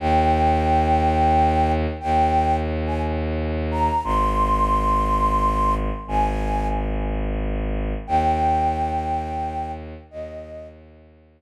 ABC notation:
X:1
M:3/4
L:1/16
Q:1/4=89
K:Eb
V:1 name="Flute"
g12 | g4 z a z4 b2 | c'12 | a4 z8 |
g12 | e4 z8 |]
V:2 name="Violin" clef=bass
E,,12 | E,,12 | A,,,12 | A,,,12 |
E,,12 | E,,12 |]